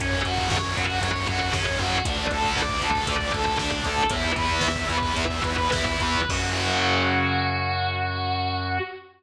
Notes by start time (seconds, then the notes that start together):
0.00 F#2 C#3 F#3 C#4, kick, closed hi-hat
0.13 kick
0.25 F#2 C#3 F#3 F#4, kick, closed hi-hat
0.38 kick
0.50 F#2 C#5, kick, snare
0.64 C#3 F#3, kick
0.76 F#2 F#4, kick, closed hi-hat
0.90 C#3 F#3, kick
1.01 F#2 C#5, kick, closed hi-hat
1.15 C#3 F#3, kick
1.27 F#2 C#3 F#3 F#4, kick, closed hi-hat
1.41 C#3 F#3, kick
1.53 F#2 C#3 F#3 C#4, kick, snare
1.66 C#3 F#3, kick
1.79 F#2 F#4, kick, closed hi-hat
1.93 kick
2.05 D2 D3 A3 D4, kick, closed hi-hat
2.18 kick
2.30 D2 D3 A3 A4, kick, closed hi-hat
2.44 kick
2.56 D2 D5, kick, snare
2.69 D3 A3, kick
2.82 D2 A4, kick, closed hi-hat
2.95 D3 A3, kick
3.07 D2 D5, kick, closed hi-hat
3.19 D3 A3, kick
3.33 D2 D3 A3 A4, kick, closed hi-hat
3.46 D3 A3, kick
3.58 D2 D3 A3 D4, kick, snare
3.72 D3 A3, kick
3.84 D2 A4, kick, closed hi-hat
3.98 kick
4.10 E2 E3 B3 E4, kick, closed hi-hat
4.24 kick
4.36 E2 E3 B3 B4, kick, closed hi-hat
4.49 kick
4.61 E2 E5, kick, snare
4.76 E3 B3, kick
4.89 E2 B4, kick, closed hi-hat
5.02 E3 B3, kick
5.16 E2 E5, kick, closed hi-hat
5.29 E3 B3, kick
5.43 E2 E3 B3 B4, kick, closed hi-hat
5.58 E3 B3, kick
5.72 E2 E3 B3 E4, kick, snare
5.86 E3 B3, kick
6.00 E2 B4, kick, closed hi-hat
6.15 kick
6.29 F#2 C#3 F#3 F#4, kick, crash